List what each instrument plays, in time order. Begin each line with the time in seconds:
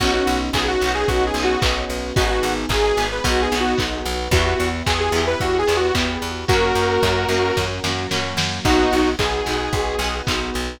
0.00 electric bass (finger) B1, electric piano 1 B3 C#4 D#4 F#4, pizzicato strings B3 C#4, pad 2 (warm) B3 C#4 D#4 F#4, lead 2 (sawtooth) F#4, kick, crash
0.05 pizzicato strings D#4 F#4
0.13 lead 2 (sawtooth) F#4
0.27 electric bass (finger) B1, open hi-hat
0.53 electric bass (finger) B1, electric piano 1 B3 C#4 D#4 F#4, lead 2 (sawtooth) G#4, kick, clap
0.68 lead 2 (sawtooth) F#4
0.81 electric bass (finger) B1, pizzicato strings B3 C#4, open hi-hat
0.86 pizzicato strings D#4 F#4
0.94 lead 2 (sawtooth) G#4
1.08 electric bass (finger) B1, electric piano 1 B3 C#4 D#4 F#4, pad 2 (warm) B3 C#4 F#4 B4, lead 2 (sawtooth) F#4, kick, closed hi-hat
1.26 lead 2 (sawtooth) G#4
1.34 electric bass (finger) B1, pizzicato strings B3, open hi-hat
1.38 pizzicato strings C#4 D#4
1.43 pizzicato strings F#4, lead 2 (sawtooth) F#4
1.61 electric bass (finger) B1, pizzicato strings B3 C#4, electric piano 1 B3 C#4 D#4 F#4, kick, clap
1.66 pizzicato strings D#4 F#4
1.89 electric bass (finger) B1, open hi-hat
2.16 electric bass (finger) G#1, pizzicato strings B3 D#4, electric piano 1 B3 D#4 G#4, pad 2 (warm) B3 D#4 G#4, lead 2 (sawtooth) F#4, kick, closed hi-hat
2.21 pizzicato strings G#4
2.30 lead 2 (sawtooth) F#4
2.43 electric bass (finger) G#1, open hi-hat
2.69 electric bass (finger) G#1, pad 2 (warm) G#3 B3 G#4, electric piano 1 B3 D#4 G#4, lead 2 (sawtooth) G#4, kick, clap
2.84 lead 2 (sawtooth) G#4
2.97 electric bass (finger) G#1, pizzicato strings B3 D#4, open hi-hat
3.03 pizzicato strings G#4
3.11 lead 2 (sawtooth) B4
3.24 electric bass (finger) B1, pizzicato strings B3 D#4, pad 2 (warm) B3 D#4 F#4, electric piano 1 B3 D#4 F#4, lead 2 (sawtooth) F#4, kick, closed hi-hat
3.29 pizzicato strings F#4
3.42 lead 2 (sawtooth) G#4
3.51 electric bass (finger) B1, pizzicato strings B3 D#4, open hi-hat
3.57 pizzicato strings F#4, lead 2 (sawtooth) F#4
3.77 electric bass (finger) B1, pad 2 (warm) B3 F#4 B4, pizzicato strings B3 D#4, electric piano 1 B3 D#4 F#4, kick, clap
3.82 pizzicato strings F#4
4.05 electric bass (finger) B1, open hi-hat
4.31 electric bass (finger) E2, pizzicato strings B3 E4, pad 2 (warm) B3 E4 G4, electric piano 1 B3 E4 G4, lead 2 (sawtooth) F#4, kick, closed hi-hat
4.36 pizzicato strings G4
4.46 lead 2 (sawtooth) F#4
4.59 electric bass (finger) E2, open hi-hat
4.86 electric bass (finger) E2, electric piano 1 B3 E4 G4, lead 2 (sawtooth) G#4, kick, clap
5.00 lead 2 (sawtooth) G#4
5.12 electric bass (finger) E2, pizzicato strings B3 E4, open hi-hat
5.18 pizzicato strings G4
5.27 lead 2 (sawtooth) B4
5.40 electric bass (finger) E2, electric piano 1 B3 E4 G4, pad 2 (warm) B3 G4 B4, lead 2 (sawtooth) F#4, kick, closed hi-hat
5.59 lead 2 (sawtooth) G#4
5.67 electric bass (finger) E2, pizzicato strings B3 E4, open hi-hat
5.72 pizzicato strings G4
5.77 lead 2 (sawtooth) F#4
5.95 electric bass (finger) E2, electric piano 1 B3 E4 G4, pizzicato strings B3 E4, kick, clap
5.99 pizzicato strings G4
6.22 electric bass (finger) E2, open hi-hat
6.47 electric bass (finger) F#2, pad 2 (warm) A#3 C#4 F#4, pizzicato strings A#3 C#4, electric piano 1 A#3 C#4 F#4, lead 2 (sawtooth) F#4 A#4, kick, closed hi-hat
6.53 pizzicato strings F#4
6.75 electric bass (finger) F#2, open hi-hat
7.03 electric bass (finger) F#2, electric piano 1 A#3 C#4 F#4, kick, clap
7.28 electric bass (finger) F#2, pizzicato strings A#3 C#4, open hi-hat
7.34 pizzicato strings F#4
7.56 electric bass (finger) F#2, pad 2 (warm) F#3 A#3 F#4, electric piano 1 A#3 C#4 F#4, kick, snare
7.84 electric bass (finger) F#2, pizzicato strings A#3 C#4, snare
7.89 pizzicato strings F#4
8.11 electric bass (finger) F#2, electric piano 1 A#3 C#4 F#4, pizzicato strings A#3 C#4, snare
8.16 pizzicato strings F#4
8.37 electric bass (finger) F#2, snare
8.65 electric bass (finger) B1, electric piano 1 B3 D#4 F#4, pizzicato strings B3 D#4, pad 2 (warm) B3 D#4 F#4, lead 2 (sawtooth) D#4 F#4, kick, crash
8.70 pizzicato strings F#4
8.92 electric bass (finger) B1, open hi-hat
9.19 electric bass (finger) B1, electric piano 1 B3 D#4 F#4, lead 2 (sawtooth) G#4, kick, clap
9.46 electric bass (finger) B1, pizzicato strings B3 D#4, open hi-hat
9.51 pizzicato strings F#4
9.73 electric bass (finger) B1, pad 2 (warm) B3 F#4 B4, electric piano 1 B3 D#4 F#4, kick, closed hi-hat
9.99 electric bass (finger) B1, pizzicato strings B3 D#4, open hi-hat
10.04 pizzicato strings F#4
10.27 electric bass (finger) B1, pizzicato strings B3 D#4, electric piano 1 B3 D#4 F#4, kick, clap
10.32 pizzicato strings F#4
10.54 electric bass (finger) B1, open hi-hat